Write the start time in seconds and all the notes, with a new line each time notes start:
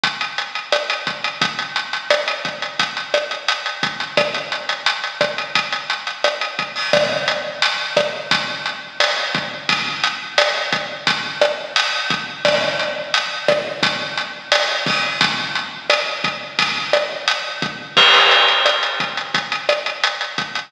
0.04 kick, closed hi-hat
0.21 closed hi-hat
0.38 closed hi-hat
0.55 closed hi-hat
0.72 cross-stick, closed hi-hat
0.90 closed hi-hat
1.07 kick, closed hi-hat
1.24 closed hi-hat
1.42 kick, closed hi-hat
1.59 closed hi-hat
1.76 closed hi-hat
1.93 closed hi-hat
2.10 cross-stick, closed hi-hat
2.28 closed hi-hat
2.45 kick, closed hi-hat
2.62 closed hi-hat
2.79 kick, closed hi-hat
2.97 closed hi-hat
3.14 cross-stick, closed hi-hat
3.31 closed hi-hat
3.48 closed hi-hat
3.66 closed hi-hat
3.83 kick, closed hi-hat
4.00 closed hi-hat
4.17 kick, cross-stick, closed hi-hat
4.34 closed hi-hat
4.52 closed hi-hat
4.69 closed hi-hat
4.86 closed hi-hat
5.04 closed hi-hat
5.21 kick, cross-stick, closed hi-hat
5.38 closed hi-hat
5.55 kick, closed hi-hat
5.72 closed hi-hat
5.90 closed hi-hat
6.07 closed hi-hat
6.24 cross-stick, closed hi-hat
6.41 closed hi-hat
6.59 kick, closed hi-hat
6.76 open hi-hat
6.93 kick, cross-stick, closed hi-hat
7.28 closed hi-hat
7.62 closed hi-hat
7.97 kick, cross-stick, closed hi-hat
8.31 kick, closed hi-hat
8.66 closed hi-hat
9.00 cross-stick, closed hi-hat
9.35 kick, closed hi-hat
9.69 kick, closed hi-hat
10.04 closed hi-hat
10.38 cross-stick, closed hi-hat
10.72 kick, closed hi-hat
11.07 kick, closed hi-hat
11.42 cross-stick, closed hi-hat
11.76 closed hi-hat
12.10 kick, closed hi-hat
12.45 kick, cross-stick, closed hi-hat
12.79 closed hi-hat
13.14 closed hi-hat
13.48 kick, cross-stick, closed hi-hat
13.83 kick, closed hi-hat
14.18 closed hi-hat
14.52 cross-stick, closed hi-hat
14.86 kick, open hi-hat
15.21 kick, closed hi-hat
15.55 closed hi-hat
15.90 cross-stick, closed hi-hat
16.24 kick, closed hi-hat
16.59 kick, closed hi-hat
16.93 cross-stick, closed hi-hat
17.28 closed hi-hat
17.62 kick, closed hi-hat
17.97 kick, crash
18.14 closed hi-hat
18.31 closed hi-hat
18.48 closed hi-hat
18.66 cross-stick, closed hi-hat
18.83 closed hi-hat
19.00 kick, closed hi-hat
19.17 closed hi-hat
19.34 kick, closed hi-hat
19.52 closed hi-hat
19.69 cross-stick, closed hi-hat
19.86 closed hi-hat
20.04 closed hi-hat
20.21 closed hi-hat
20.38 kick, closed hi-hat
20.55 closed hi-hat